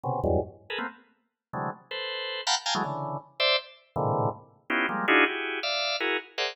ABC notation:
X:1
M:5/8
L:1/16
Q:1/4=161
K:none
V:1 name="Drawbar Organ"
[B,,C,^C,]2 [E,,^F,,G,,^G,,]2 z3 [^GA^AB] [=A,^A,B,=C] z | z6 [C,D,E,^F,^G,A,]2 z2 | [ABc]6 [f^fga^ab] z [=fg^g=a^a] [E,^F,^G,=A,] | [^C,D,E,]4 z2 [=cde]2 z2 |
z2 [^G,,A,,^A,,C,D,E,]4 z4 | [B,^C^DEFG]2 [F,G,^G,^A,]2 [=D^DEF^F^G]2 [EF=G^G]4 | [def]4 [E^F^G^A]2 z2 [GAcde^f]2 |]